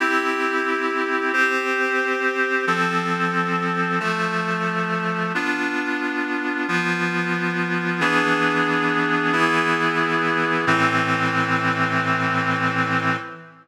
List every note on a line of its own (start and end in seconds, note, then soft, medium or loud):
0.00 1.32 C4 medium
0.00 1.32 E4 medium
0.00 1.32 G4 medium
1.33 2.65 C4 medium
1.33 2.65 G4 medium
1.33 2.65 C5 medium
2.67 3.99 F3 medium
2.67 3.99 C4 medium
2.67 3.99 A4 medium
4.00 5.32 F3 medium
4.00 5.32 A3 medium
4.00 5.32 A4 medium
5.35 6.67 B3 medium
5.35 6.67 D4 medium
5.35 6.67 F4 medium
6.68 8.00 F3 medium
6.68 8.00 B3 medium
6.68 8.00 F4 medium
8.00 9.32 E3 medium
8.00 9.32 B3 medium
8.00 9.33 D4 medium
8.00 9.32 G#4 medium
9.33 10.65 E3 medium
9.33 10.65 B3 medium
9.33 10.65 E4 medium
9.33 10.65 G#4 medium
10.67 13.17 A2 loud
10.67 13.17 E3 loud
10.67 13.17 C4 loud